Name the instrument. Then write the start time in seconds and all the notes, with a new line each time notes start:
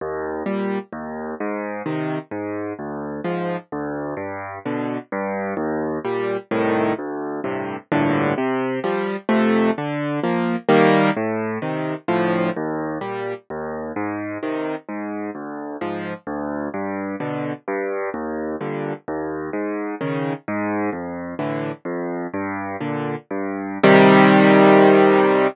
acoustic grand piano
0.01 D#2
0.46 A#2 G3
0.93 D#2
1.40 G#2
1.86 C3 D#3
2.31 G#2
2.79 D2
3.24 G#2 F3
3.72 D2
4.17 G2
4.66 B2 D3
5.12 G2
5.57 D#2
6.05 A#2 G3
6.51 C2 A2 D#3
6.98 D2
7.44 G2 A2 C3
7.92 A#1 G2 A2 D3
8.38 C3
8.84 F3 G3
9.29 F2 C3 A3
9.78 D3
10.23 F3 A#3
10.69 D#3 G3 A#3
11.17 A2
11.62 C3 D#3
12.08 D2 A2 F3
12.56 D#2
13.01 A#2 G3
13.50 D#2
13.96 G#2
14.43 C3 D#3
14.89 G#2
15.35 D2
15.81 G#2 F3
16.27 D2
16.74 G2
17.20 B2 D3
17.68 G2
18.14 D#2
18.61 G2 A#2 D3
19.08 D#2
19.53 G#2
20.01 C#3 D#3
20.48 G#2
20.93 F2
21.39 A2 D3 E3
21.85 F2
22.34 G2
22.80 A#2 D3
23.31 G2
23.84 C3 D#3 G3